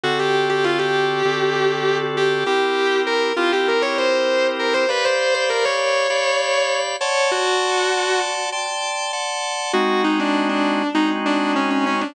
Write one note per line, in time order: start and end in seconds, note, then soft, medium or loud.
0.04 1.23 D3 medium
0.04 1.23 C4 medium
0.04 0.18 F#4 loud
0.04 1.23 F#4 medium
0.04 1.23 A4 medium
0.19 0.48 G4 medium
0.49 0.64 G4 medium
0.64 0.79 F4 medium
0.79 1.98 G4 medium
1.25 2.44 D3 medium
1.25 2.44 C4 medium
1.25 2.44 F#4 medium
1.25 2.44 A4 medium
2.17 2.43 G4 medium
2.46 3.33 C4 medium
2.46 3.33 E4 medium
2.46 3.33 G4 medium
2.46 3.00 G4 medium
2.46 3.33 A#4 medium
3.07 3.32 A#4 medium
3.37 4.86 C4 medium
3.37 4.86 E4 medium
3.37 3.51 F4 medium
3.37 4.86 G4 medium
3.37 4.86 A#4 medium
3.52 3.67 G4 medium
3.68 3.82 A#4 medium
3.82 3.96 C#5 medium
3.98 4.47 C5 medium
4.59 4.74 A#4 medium
4.74 4.88 C5 medium
4.89 6.07 G4 medium
4.89 5.04 B4 medium
4.89 6.07 D5 medium
4.89 6.07 F5 medium
4.89 6.07 B5 medium
5.05 5.34 C5 medium
5.34 5.49 C5 medium
5.49 5.64 A#4 medium
5.65 6.76 C#5 medium
6.10 6.96 G4 medium
6.10 6.96 D5 medium
6.10 6.96 F5 medium
6.10 6.96 B5 medium
7.01 7.30 C#5 medium
7.01 8.50 D5 medium
7.01 8.50 F#5 medium
7.01 8.50 A5 medium
7.01 8.50 C6 medium
7.31 8.18 F#4 loud
8.52 9.12 D5 medium
8.52 9.12 G5 medium
8.52 9.12 A5 medium
8.52 9.12 C6 medium
9.13 9.72 D5 medium
9.13 9.72 F#5 medium
9.13 9.72 A5 medium
9.13 9.72 C6 medium
9.73 10.83 G#3 loud
9.73 10.83 C4 loud
9.73 10.83 D#4 loud
9.73 10.01 F#4 medium
9.73 10.83 F#4 loud
10.04 10.18 D#4 medium
10.19 10.47 D4 medium
10.49 10.88 D4 medium
10.95 12.04 G#3 medium
10.95 12.04 C4 medium
10.95 11.09 D#4 medium
10.95 12.04 D#4 medium
10.95 12.04 F#4 medium
11.26 11.52 D4 medium
11.56 11.70 C#4 medium
11.70 11.85 C#4 medium
11.86 12.01 C#4 medium
12.01 12.14 D4 medium